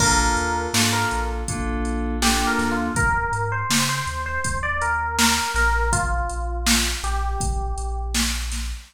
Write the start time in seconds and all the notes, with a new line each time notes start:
0.00 A#1 A#3 D4 F4 A4 A#4, kick, crash
0.36 D#2, closed hi-hat
0.73 G#2 A#3 D4 F4 A4, snare
0.93 A#4
1.11 A#1, closed hi-hat
1.48 A#1 A#3 D4 F4 A4, kick, closed hi-hat
1.85 closed hi-hat
2.22 A#3 D4 F4 G4 A4, snare
2.47 A#4
2.58 D#2, snare, closed hi-hat
2.71 F4
2.95 D#2 A#4, kick, closed hi-hat
3.32 G#2, closed hi-hat
3.52 C5
3.70 C#3, snare
3.89 C5
4.07 D#2, closed hi-hat
4.26 C5
4.44 D#2, kick, closed hi-hat
4.63 D5
4.81 A#4, closed hi-hat
5.19 A#4, snare
5.54 A#1 A#4, snare, closed hi-hat
5.93 F4, kick, closed hi-hat
6.29 A#1, closed hi-hat
6.67 snare
7.03 A#1 G4, closed hi-hat
7.40 A#1, kick, closed hi-hat
7.78 A#1, closed hi-hat
8.15 snare
8.52 snare, closed hi-hat